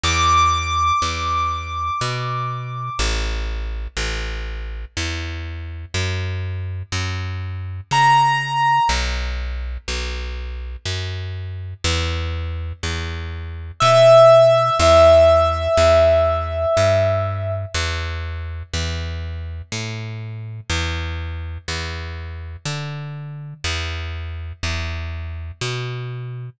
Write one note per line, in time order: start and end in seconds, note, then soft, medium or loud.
0.03 0.92 E2 loud
0.03 2.99 D6 medium
1.02 1.90 E2 medium
2.01 2.90 B2 medium
2.99 3.88 A1 loud
3.97 4.85 A1 medium
4.97 5.85 E2 medium
5.94 6.83 F#2 medium
6.92 7.81 F#2 medium
7.91 8.80 C#3 medium
7.91 8.89 A#5 medium
8.89 9.77 B1 loud
9.88 10.76 B1 medium
10.85 11.74 F#2 medium
11.84 12.73 E2 loud
12.83 13.72 E2 medium
13.80 14.70 B2 medium
13.80 14.75 E5 medium
14.79 15.68 E2 loud
14.79 17.51 E5 medium
15.77 16.66 E2 loud
16.77 17.65 G2 loud
17.74 18.63 E2 loud
18.73 19.62 E2 medium
19.72 20.60 A2 medium
20.69 21.58 E2 loud
21.68 22.57 E2 medium
22.65 23.54 D3 medium
23.64 24.53 E2 loud
24.63 25.51 E2 medium
25.61 26.50 B2 medium